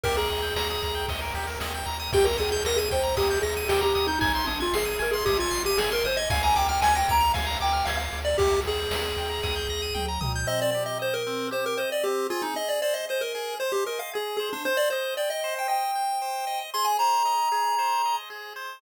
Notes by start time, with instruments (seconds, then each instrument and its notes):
0.03 synth bass 1 D#2, lead 1 (square) G4 A#4, kick, ride
0.17 lead 1 (square) G#4 A#4
0.29 synth bass 1 D#2, lead 1 (square) D#5, snare, ride
0.42 lead 1 (square) G5
0.56 synth bass 1 D#2, lead 1 (square) A#5, snare
0.70 lead 1 (square) D#6
0.82 synth bass 1 D#2, lead 1 (square) A#5, kick, ride
0.95 lead 1 (square) G5
1.08 synth bass 1 D#2, lead 1 (square) D#5, kick, ride
1.21 lead 1 (square) A#4
1.34 synth bass 1 D#2, lead 1 (square) G4, ride
1.47 lead 1 (square) A#4
1.60 synth bass 1 D#2, lead 1 (square) D#5, snare
1.74 lead 1 (square) G5
1.86 synth bass 1 D#2, lead 1 (square) A#5, ride
1.99 lead 1 (square) D#6
2.13 synth bass 1 D#2, lead 1 (square) G4 G5, kick, crash
2.24 lead 1 (square) A#4 A#5
2.38 synth bass 1 D#2, lead 1 (square) G#4 D#6, snare, ride
2.51 lead 1 (square) G#4 G6
2.65 synth bass 1 D#2, lead 1 (square) A#4 A#6, snare
2.76 lead 1 (square) G#4 D#7
2.91 synth bass 1 D#2, lead 1 (square) C5 G5, kick, ride
3.03 lead 1 (square) A#5
3.17 synth bass 1 D#2, lead 1 (square) G4 D#6, kick, ride
3.30 lead 1 (square) G6
3.42 synth bass 1 D#2, lead 1 (square) G#4 A#6, ride
3.57 lead 1 (square) D#7
3.69 synth bass 1 D#2, lead 1 (square) G4 G5, snare
3.81 lead 1 (square) G4 A#5
3.95 synth bass 1 D#2, lead 1 (square) D#6, ride
4.07 lead 1 (square) D#4 G6
4.19 synth bass 1 G#1, lead 1 (square) D#4 G#5, kick, ride
4.35 lead 1 (square) C6
4.47 synth bass 1 G#1, lead 1 (square) D4 D#6, snare, ride
4.60 lead 1 (square) F4 G#6
4.73 synth bass 1 G#1, lead 1 (square) G#4 C7, snare
4.85 lead 1 (square) D#7
4.99 synth bass 1 G#1, lead 1 (square) A#4 G#5, ride
5.11 lead 1 (square) G#4 C6
5.25 synth bass 1 G#1, lead 1 (square) G4 D#6, kick, ride
5.38 lead 1 (square) F4 G#6
5.51 synth bass 1 G#1, lead 1 (square) C7, ride
5.65 lead 1 (square) G4 D#7
5.77 synth bass 1 G#1, lead 1 (square) G#4 G#5, snare
5.92 lead 1 (square) A#4 C6
6.04 synth bass 1 G#1, lead 1 (square) C5 D#6, ride
6.17 lead 1 (square) D#5 G#6
6.30 synth bass 1 D2, lead 1 (square) F5 G#5, kick, ride
6.43 lead 1 (square) G#5 A#5
6.55 synth bass 1 D2, lead 1 (square) G5 D6, snare, ride
6.69 lead 1 (square) G5 F6
6.81 synth bass 1 D2, lead 1 (square) G#5 G#6, snare
6.95 lead 1 (square) G5 A#6
7.08 synth bass 1 D2, lead 1 (square) A#5 D7, kick, ride
7.20 lead 1 (square) F7
7.34 synth bass 1 D2, lead 1 (square) F5 G#5, kick, ride
7.46 lead 1 (square) A#5
7.60 synth bass 1 D2, lead 1 (square) G5 D6, ride
7.73 lead 1 (square) F6
7.85 synth bass 1 D2, lead 1 (square) F5 G#6, snare
7.97 lead 1 (square) F5 A#6
8.12 synth bass 1 D2, lead 1 (square) D7, ride
8.25 lead 1 (square) D5 F7
8.38 synth bass 1 D#2, lead 1 (square) G4 G5, kick, ride
8.52 lead 1 (square) A#5
8.65 synth bass 1 D#2, lead 1 (square) G#4 D#6, snare, ride
8.78 lead 1 (square) G6
8.90 synth bass 1 D#2, lead 1 (square) A#6, snare
9.03 lead 1 (square) D#7
9.17 synth bass 1 D#2, lead 1 (square) G5, ride
9.29 lead 1 (square) A#5
9.43 synth bass 1 D#2, lead 1 (square) D#6, kick, snare
9.56 lead 1 (square) G6
9.69 synth bass 1 D#2, lead 1 (square) A#6
9.82 lead 1 (square) D#7
9.94 synth bass 1 D2, lead 1 (square) G5, mid tom
10.08 lead 1 (square) A#5
10.21 synth bass 1 C#2, lead 1 (square) D#6, floor tom
10.35 lead 1 (square) G6
10.47 lead 1 (square) C4 D#5
10.62 lead 1 (square) D5
10.71 lead 1 (square) G4 D5
10.86 lead 1 (square) D#5
10.99 lead 1 (square) C5 D#5
11.14 lead 1 (square) A#4
11.27 lead 1 (square) C4
11.51 lead 1 (square) G4 C5
11.66 lead 1 (square) A#4
11.77 lead 1 (square) C5 D#5
11.92 lead 1 (square) D5
12.03 lead 1 (square) C4 G4
12.30 lead 1 (square) F4 G#4
12.42 lead 1 (square) D#4
12.56 lead 1 (square) D#5
12.69 lead 1 (square) D5
12.82 lead 1 (square) C5 D5
12.94 lead 1 (square) D#5
13.09 lead 1 (square) C5 D#5
13.21 lead 1 (square) A#4
13.35 lead 1 (square) G#4
13.60 lead 1 (square) C5
13.72 lead 1 (square) G4
13.86 lead 1 (square) A#4 D#5
13.99 lead 1 (square) F5
14.13 lead 1 (square) G#4
14.37 lead 1 (square) G#4 C5
14.53 lead 1 (square) D4
14.65 lead 1 (square) C5
14.77 lead 1 (square) D5
14.90 lead 1 (square) C5 D#5
15.17 lead 1 (square) D5 G5
15.30 lead 1 (square) D#5
15.44 lead 1 (square) C5
15.59 lead 1 (square) G5
15.68 lead 1 (square) D#5 G5
15.95 lead 1 (square) G5
16.22 lead 1 (square) C5
16.47 lead 1 (square) D#5
16.74 lead 1 (square) G#4 C6
16.85 lead 1 (square) G#5
16.99 lead 1 (square) C5 A#5
17.25 lead 1 (square) D#5
17.52 lead 1 (square) G#4
17.78 lead 1 (square) C5
18.05 lead 1 (square) D#5
18.30 lead 1 (square) G#4
18.56 lead 1 (square) C5